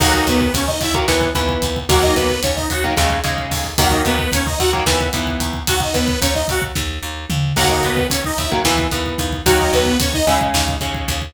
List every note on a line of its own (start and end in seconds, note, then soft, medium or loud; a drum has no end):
0.00 0.23 D#2 loud
0.00 0.43 D#3 loud
0.00 0.43 F#3 loud
0.00 0.43 A#3 loud
0.00 0.13 F#4 loud
0.00 0.13 F#5 loud
0.00 kick loud
0.00 crash loud
0.14 0.27 D#4 medium
0.14 0.27 D#5 loud
0.14 kick medium
0.27 0.50 D#2 loud
0.27 0.53 B3 medium
0.27 0.53 B4 loud
0.27 kick loud
0.27 closed hi-hat medium
0.41 kick loud
0.54 0.77 D#2 medium
0.54 0.68 C#4 medium
0.54 0.68 C#5 loud
0.54 kick loud
0.54 closed hi-hat loud
0.67 0.80 D#4 medium
0.67 0.80 D#5 loud
0.67 kick medium
0.81 1.04 D#2 medium
0.81 0.95 E4 loud
0.81 0.95 E5 loud
0.81 kick loud
0.81 closed hi-hat medium
0.94 1.06 D#3 loud
0.94 1.06 F#3 medium
0.94 1.06 A#3 medium
0.94 kick loud
1.08 1.31 D#2 medium
1.08 1.30 E3 loud
1.08 1.30 B3 loud
1.08 kick loud
1.08 snare loud
1.21 kick loud
1.35 1.58 D#2 medium
1.35 1.78 E3 loud
1.35 1.78 B3 medium
1.35 kick loud
1.35 closed hi-hat medium
1.49 kick loud
1.62 1.85 D#2 medium
1.62 kick loud
1.62 closed hi-hat medium
1.76 kick medium
1.89 2.12 D#2 loud
1.89 2.32 D#3 loud
1.89 2.32 F#3 loud
1.89 2.32 A#3 loud
1.89 2.03 F#4 loud
1.89 2.03 F#5 loud
1.89 kick loud
1.89 closed hi-hat loud
2.02 2.15 D#4 medium
2.02 2.15 D#5 loud
2.02 kick loud
2.15 2.39 D#2 medium
2.15 2.41 B3 medium
2.15 2.41 B4 loud
2.15 kick medium
2.15 closed hi-hat medium
2.30 kick medium
2.43 2.66 D#2 medium
2.43 2.56 C#4 medium
2.43 2.56 C#5 medium
2.43 kick loud
2.43 closed hi-hat loud
2.56 2.69 D#4 medium
2.56 2.69 D#5 loud
2.56 kick medium
2.70 2.93 D#2 medium
2.70 2.84 F#4 loud
2.70 2.84 F#5 loud
2.70 kick medium
2.70 closed hi-hat medium
2.84 2.95 D#3 loud
2.84 2.95 F#3 medium
2.84 2.95 A#3 medium
2.84 kick medium
2.97 3.20 D#2 loud
2.97 3.19 C#3 loud
2.97 3.19 G#3 loud
2.97 kick loud
2.97 snare loud
3.10 kick loud
3.24 3.47 D#2 medium
3.24 3.67 C#3 loud
3.24 3.67 G#3 medium
3.24 kick medium
3.24 closed hi-hat medium
3.38 kick medium
3.51 3.74 D#2 medium
3.51 kick loud
3.51 open hi-hat medium
3.64 kick medium
3.78 4.01 D#2 loud
3.78 4.22 D#3 loud
3.78 4.22 F#3 medium
3.78 4.22 A#3 loud
3.78 3.92 F#4 loud
3.78 3.92 F#5 loud
3.78 kick loud
3.78 closed hi-hat loud
3.90 4.03 D#4 medium
3.90 4.03 D#5 loud
3.90 kick loud
4.05 4.28 D#2 medium
4.05 4.31 B3 loud
4.05 4.31 B4 loud
4.05 kick loud
4.05 closed hi-hat medium
4.19 kick loud
4.32 4.55 D#2 medium
4.32 4.46 C#4 medium
4.32 4.46 C#5 loud
4.32 kick loud
4.32 closed hi-hat loud
4.46 4.59 D#4 medium
4.46 4.59 D#5 loud
4.46 kick loud
4.59 4.83 D#2 medium
4.59 4.72 F#4 loud
4.59 4.72 F#5 loud
4.59 kick medium
4.59 closed hi-hat medium
4.73 4.84 D#3 loud
4.73 4.84 F#3 medium
4.73 4.84 A#3 loud
4.73 kick loud
4.86 5.09 D#2 loud
4.86 5.08 E3 loud
4.86 5.08 B3 loud
4.86 kick loud
4.86 snare loud
5.01 kick medium
5.13 5.37 D#2 medium
5.13 5.57 E3 loud
5.13 5.57 B3 loud
5.13 kick loud
5.13 closed hi-hat loud
5.27 kick medium
5.40 5.63 D#2 medium
5.40 kick medium
5.40 closed hi-hat loud
5.53 kick medium
5.67 5.91 D#2 loud
5.67 5.81 F#4 loud
5.67 5.81 F#5 loud
5.67 kick loud
5.67 closed hi-hat loud
5.80 5.94 D#4 medium
5.80 5.94 D#5 medium
5.80 kick loud
5.93 6.17 D#2 medium
5.93 6.20 B3 medium
5.93 6.20 B4 loud
5.93 kick medium
5.93 closed hi-hat medium
6.08 kick loud
6.21 6.45 D#2 medium
6.21 6.34 C#4 medium
6.21 6.34 C#5 loud
6.21 kick loud
6.21 closed hi-hat loud
6.35 6.47 D#4 medium
6.35 6.47 D#5 loud
6.35 kick medium
6.48 6.72 D#2 medium
6.48 6.63 F#4 loud
6.48 6.63 F#5 loud
6.48 kick loud
6.48 closed hi-hat medium
6.62 kick loud
6.75 6.99 D#2 medium
6.75 kick loud
6.75 snare medium
7.03 7.26 D#2 medium
7.30 7.53 D#2 medium
7.30 mid tom loud
7.56 7.80 D#2 medium
7.56 8.00 D#3 loud
7.56 8.00 F#3 loud
7.56 8.00 A#3 loud
7.56 7.69 F#4 loud
7.56 7.69 F#5 loud
7.56 kick loud
7.56 crash loud
7.70 7.83 D#4 medium
7.70 7.83 D#5 loud
7.70 kick medium
7.83 8.07 D#2 medium
7.83 8.07 B3 medium
7.83 8.07 B4 loud
7.83 kick medium
7.83 closed hi-hat medium
7.97 kick loud
8.09 8.34 D#2 medium
8.09 8.22 C#4 medium
8.09 8.22 C#5 loud
8.09 kick loud
8.09 closed hi-hat loud
8.24 8.38 D#4 loud
8.24 8.38 D#5 loud
8.24 kick loud
8.38 8.61 D#2 medium
8.38 8.51 E4 medium
8.38 8.51 E5 medium
8.38 kick loud
8.38 closed hi-hat medium
8.51 8.62 D#3 loud
8.51 8.62 F#3 loud
8.51 8.62 A#3 medium
8.51 kick loud
8.65 8.88 D#2 loud
8.65 8.87 E3 loud
8.65 8.87 B3 loud
8.65 kick loud
8.65 snare loud
8.78 kick loud
8.91 9.15 D#2 medium
8.91 9.35 E3 medium
8.91 9.35 B3 medium
8.91 kick medium
8.91 closed hi-hat medium
9.06 kick medium
9.18 9.42 D#2 medium
9.18 kick loud
9.18 closed hi-hat medium
9.33 kick medium
9.45 9.69 D#2 loud
9.45 9.89 D#3 loud
9.45 9.89 F#3 loud
9.45 9.89 A#3 loud
9.45 9.58 F#4 loud
9.45 9.58 F#5 loud
9.45 kick loud
9.45 closed hi-hat loud
9.59 9.72 D#4 medium
9.59 9.72 D#5 loud
9.59 kick medium
9.73 9.96 D#2 medium
9.73 9.98 B3 medium
9.73 9.98 B4 loud
9.73 kick medium
9.73 closed hi-hat medium
9.86 kick medium
10.00 10.23 D#2 medium
10.00 10.14 C#4 medium
10.00 10.14 C#5 loud
10.00 kick loud
10.00 closed hi-hat loud
10.14 10.26 D#4 loud
10.14 10.26 D#5 loud
10.14 kick loud
10.27 10.50 D#2 medium
10.27 10.76 C#3 loud
10.27 10.76 G#3 loud
10.27 10.39 E4 medium
10.27 10.39 E5 loud
10.27 kick medium
10.27 closed hi-hat medium
10.41 kick loud
10.54 10.77 D#2 loud
10.54 kick loud
10.54 snare loud
10.68 kick loud
10.81 11.04 D#2 medium
10.81 11.24 C#3 medium
10.81 11.24 G#3 medium
10.81 kick medium
10.81 closed hi-hat medium
10.94 kick loud
11.08 11.31 D#2 medium
11.08 kick loud
11.08 closed hi-hat medium
11.22 kick medium